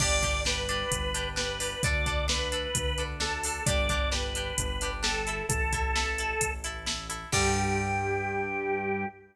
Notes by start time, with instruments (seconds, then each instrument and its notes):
0.00 synth bass 1 G1, acoustic guitar (steel) D4 G4, drawbar organ D5, kick, crash
0.22 acoustic guitar (steel) D4 G4, kick, closed hi-hat
0.45 acoustic guitar (steel) D4 G4, drawbar organ B4, snare
0.69 acoustic guitar (steel) D4 G4, closed hi-hat
0.91 synth bass 1 G1, kick, closed hi-hat
1.14 acoustic guitar (steel) D4 G4, closed hi-hat
1.36 acoustic guitar (steel) D4 G4, drawbar organ B4, snare
1.60 acoustic guitar (steel) D4 G4, open hi-hat
1.83 synth bass 1 D2, acoustic guitar (steel) D4 A4, drawbar organ D5, kick, closed hi-hat
2.06 acoustic guitar (steel) D4 A4, kick, closed hi-hat
2.28 acoustic guitar (steel) D4 A4, drawbar organ B4, snare
2.52 acoustic guitar (steel) D4 A4, closed hi-hat
2.75 synth bass 1 D2, kick, closed hi-hat
2.98 acoustic guitar (steel) D4 A4, closed hi-hat
3.20 acoustic guitar (steel) D4 A4, drawbar organ A4, snare
3.44 acoustic guitar (steel) D4 A4, open hi-hat
3.66 synth bass 1 G1, acoustic guitar (steel) D4 G4, drawbar organ D5, kick, closed hi-hat
3.89 acoustic guitar (steel) D4 G4, kick, closed hi-hat
4.11 acoustic guitar (steel) D4 G4, drawbar organ B4, snare
4.35 acoustic guitar (steel) D4 G4, closed hi-hat
4.58 synth bass 1 G1, kick, closed hi-hat
4.81 acoustic guitar (steel) D4 G4, closed hi-hat
5.03 acoustic guitar (steel) D4 G4, drawbar organ A4, snare
5.27 acoustic guitar (steel) E4 A4, closed hi-hat
5.49 synth bass 1 A1, drawbar organ A4, kick, closed hi-hat
5.73 acoustic guitar (steel) E4 A4, kick, closed hi-hat
5.96 acoustic guitar (steel) E4 A4, snare
6.18 acoustic guitar (steel) E4 A4, closed hi-hat
6.41 synth bass 1 A1, kick, closed hi-hat
6.64 acoustic guitar (steel) E4 A4, closed hi-hat
6.86 acoustic guitar (steel) E4 A4, snare
7.10 acoustic guitar (steel) E4 A4, closed hi-hat
7.32 synth bass 1 G2, acoustic guitar (steel) D3 G3, drawbar organ G4, kick, crash